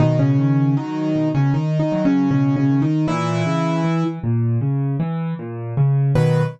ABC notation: X:1
M:4/4
L:1/16
Q:1/4=78
K:B
V:1 name="Acoustic Grand Piano"
[D,D] [C,C]3 [D,D]3 [C,C] (3[D,D]2 [D,D]2 [C,C]2 (3[C,C]2 [C,C]2 [D,D]2 | [E,E]6 z10 | B4 z12 |]
V:2 name="Acoustic Grand Piano" clef=bass
B,,2 D,2 F,2 B,,2 z2 F,2 B,,2 D,2 | A,,2 C,2 E,2 A,,2 C,2 E,2 A,,2 C,2 | [B,,D,F,]4 z12 |]